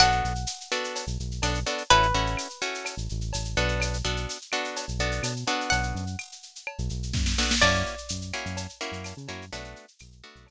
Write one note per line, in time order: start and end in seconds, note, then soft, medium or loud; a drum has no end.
0.00 0.22 B1 medium
0.00 0.33 B3 medium
0.00 0.33 D4 medium
0.00 0.33 F#4 medium
0.00 0.33 A4 medium
0.00 1.85 F#5 medium
0.00 cowbell medium
0.00 claves medium
0.00 shaker loud
0.12 shaker medium
0.24 0.46 B1 medium
0.24 shaker medium
0.35 shaker medium
0.47 tambourine medium
0.47 shaker loud
0.61 shaker medium
0.72 1.05 B3 medium
0.72 1.05 D4 medium
0.72 1.05 F#4 medium
0.72 1.05 A4 medium
0.72 claves medium
0.72 shaker medium
0.84 shaker medium
0.95 cowbell medium
0.95 shaker loud
1.07 1.18 B1 medium
1.07 shaker medium
1.20 1.41 B1 medium
1.20 shaker medium
1.31 shaker medium
1.42 1.64 B1 loud
1.42 1.60 B3 medium
1.42 1.60 D4 medium
1.42 1.60 F#4 medium
1.42 1.60 A4 medium
1.42 tambourine medium
1.42 cowbell medium
1.42 claves medium
1.42 shaker medium
1.54 shaker medium
1.66 1.83 B3 medium
1.66 1.83 D4 medium
1.66 1.83 F#4 medium
1.66 1.83 A4 medium
1.66 cowbell medium
1.66 shaker medium
1.78 shaker medium
1.90 2.12 A1 loud
1.90 2.07 C#4 loud
1.90 2.07 E4 medium
1.90 2.07 F#4 medium
1.90 2.07 A4 medium
1.90 3.68 B4 medium
1.90 cowbell medium
1.90 shaker medium
2.03 shaker medium
2.14 2.36 A1 loud
2.14 2.48 C#4 medium
2.14 2.48 E4 medium
2.14 2.48 F#4 medium
2.14 2.48 A4 medium
2.14 shaker medium
2.26 shaker medium
2.37 tambourine medium
2.37 claves medium
2.37 shaker medium
2.50 shaker medium
2.61 2.95 C#4 medium
2.61 2.95 E4 medium
2.61 2.95 F#4 medium
2.61 2.95 A4 medium
2.61 shaker medium
2.75 shaker medium
2.85 cowbell medium
2.85 claves medium
2.85 shaker medium
2.97 3.08 A1 medium
2.97 shaker medium
3.09 3.32 A1 medium
3.09 shaker medium
3.21 shaker medium
3.33 3.55 A1 medium
3.33 tambourine medium
3.33 cowbell medium
3.33 shaker loud
3.45 shaker medium
3.56 4.02 B1 loud
3.56 3.98 B3 medium
3.56 3.98 D4 medium
3.56 3.98 F#4 medium
3.56 3.98 A4 medium
3.56 cowbell medium
3.56 shaker medium
3.68 shaker medium
3.80 cowbell medium
3.80 claves loud
3.80 shaker loud
3.94 shaker medium
4.05 4.26 B1 medium
4.05 4.38 B3 medium
4.05 4.38 D4 medium
4.05 4.38 F#4 medium
4.05 4.38 A4 medium
4.05 shaker medium
4.16 shaker medium
4.29 tambourine medium
4.29 shaker medium
4.41 shaker medium
4.52 4.86 B3 medium
4.52 4.86 D4 medium
4.52 4.86 F#4 medium
4.52 4.86 A4 medium
4.52 claves medium
4.52 shaker medium
4.64 shaker medium
4.76 cowbell medium
4.76 shaker loud
4.88 4.99 B1 medium
4.88 shaker medium
4.99 5.20 B1 medium
4.99 5.33 B3 medium
4.99 5.33 D4 medium
4.99 5.33 F#4 medium
4.99 5.33 A4 medium
4.99 shaker medium
5.12 shaker medium
5.23 5.44 B2 medium
5.23 tambourine medium
5.23 cowbell medium
5.23 claves medium
5.23 shaker loud
5.36 shaker medium
5.47 6.05 B3 medium
5.47 6.05 D4 medium
5.47 6.05 F#4 medium
5.47 6.05 A4 medium
5.47 cowbell medium
5.47 shaker medium
5.61 shaker medium
5.70 5.93 B1 medium
5.70 7.48 F#5 medium
5.70 cowbell medium
5.70 shaker medium
5.83 shaker medium
5.95 6.16 F#2 medium
5.95 shaker medium
6.07 shaker medium
6.19 tambourine medium
6.19 claves medium
6.19 shaker medium
6.32 shaker medium
6.43 shaker medium
6.56 shaker medium
6.67 cowbell medium
6.67 claves medium
6.78 6.89 B1 loud
6.78 shaker medium
6.89 7.12 B1 medium
6.89 shaker medium
7.03 shaker medium
7.13 7.35 F#2 medium
7.13 kick medium
7.13 snare medium
7.26 snare medium
7.38 7.55 B3 medium
7.38 7.55 D4 medium
7.38 7.55 F#4 medium
7.38 7.55 A4 medium
7.38 snare medium
7.51 snare loud
7.62 7.83 F#2 loud
7.62 7.95 A#3 medium
7.62 7.95 C#4 medium
7.62 7.95 E4 medium
7.62 7.95 F#4 medium
7.62 9.43 D5 medium
7.62 crash medium
7.62 cowbell loud
7.62 claves loud
7.75 shaker medium
7.86 shaker medium
7.98 shaker medium
8.09 8.32 F#2 medium
8.09 tambourine medium
8.09 shaker loud
8.21 shaker medium
8.33 8.67 A#3 medium
8.33 8.67 C#4 medium
8.33 8.67 E4 medium
8.33 8.67 F#4 medium
8.33 claves medium
8.33 shaker medium
8.46 8.67 F#2 loud
8.46 shaker medium
8.57 cowbell medium
8.57 shaker loud
8.69 shaker medium
8.81 9.14 A#3 medium
8.81 9.14 C#4 medium
8.81 9.14 E4 medium
8.81 9.14 F#4 medium
8.81 shaker medium
8.92 9.13 F#2 medium
8.92 shaker medium
9.04 tambourine medium
9.04 cowbell medium
9.04 claves medium
9.04 shaker loud
9.17 9.28 C#3 loud
9.17 shaker medium
9.28 9.50 F#2 medium
9.28 9.45 A#3 medium
9.28 9.45 C#4 medium
9.28 9.45 E4 medium
9.28 9.45 F#4 medium
9.28 cowbell medium
9.28 shaker medium
9.41 shaker medium
9.52 9.74 B1 medium
9.52 9.86 A3 medium
9.52 9.86 B3 medium
9.52 9.86 D4 medium
9.52 9.86 F#4 medium
9.52 cowbell medium
9.52 shaker loud
9.64 shaker medium
9.76 shaker medium
9.88 shaker medium
9.99 10.22 B1 medium
9.99 tambourine medium
9.99 claves medium
9.99 shaker medium
10.12 shaker medium
10.24 10.51 A3 medium
10.24 10.51 B3 medium
10.24 10.51 D4 medium
10.24 10.51 F#4 medium
10.24 shaker medium
10.36 10.51 B1 medium
10.36 shaker medium
10.47 cowbell medium
10.47 claves medium
10.47 shaker medium